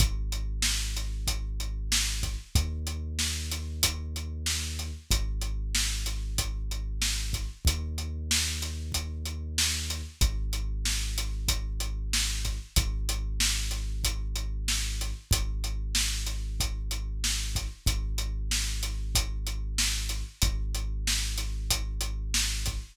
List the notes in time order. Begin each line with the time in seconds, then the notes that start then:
0.00 G#1, kick, closed hi-hat
0.32 closed hi-hat
0.62 snare
0.97 closed hi-hat
1.27 kick, closed hi-hat
1.60 closed hi-hat
1.92 snare
2.23 kick, closed hi-hat
2.55 D#2, kick, closed hi-hat
2.87 closed hi-hat
3.19 snare
3.51 closed hi-hat
3.83 kick, closed hi-hat
4.16 closed hi-hat
4.46 snare
4.79 closed hi-hat
5.11 G#1, kick, closed hi-hat
5.41 closed hi-hat
5.75 snare
6.06 closed hi-hat
6.38 kick, closed hi-hat
6.71 closed hi-hat
7.02 snare
7.33 kick, closed hi-hat
7.65 D#2, kick, closed hi-hat
7.98 closed hi-hat
8.31 snare
8.61 snare, closed hi-hat
8.92 kick, closed hi-hat
9.26 closed hi-hat
9.58 snare
9.90 closed hi-hat
10.21 G#1, kick, closed hi-hat
10.53 closed hi-hat
10.85 snare
11.18 closed hi-hat
11.48 kick, closed hi-hat
11.80 closed hi-hat
12.13 snare
12.45 kick, closed hi-hat
12.76 G#1, kick, closed hi-hat
13.09 closed hi-hat
13.40 snare
13.71 closed hi-hat
14.04 kick, closed hi-hat
14.36 closed hi-hat
14.68 snare
15.01 closed hi-hat
15.31 G#1, kick, closed hi-hat
15.64 closed hi-hat
15.95 snare
16.26 closed hi-hat
16.60 kick, closed hi-hat
16.91 closed hi-hat
17.24 snare
17.55 kick, closed hi-hat
17.86 G#1, kick, closed hi-hat
18.18 closed hi-hat
18.51 snare
18.83 closed hi-hat
19.15 kick, closed hi-hat
19.47 closed hi-hat
19.78 snare
20.09 closed hi-hat
20.42 G#1, kick, closed hi-hat
20.75 closed hi-hat
21.07 snare
21.38 closed hi-hat
21.70 kick, closed hi-hat
22.01 closed hi-hat
22.34 snare
22.66 kick, closed hi-hat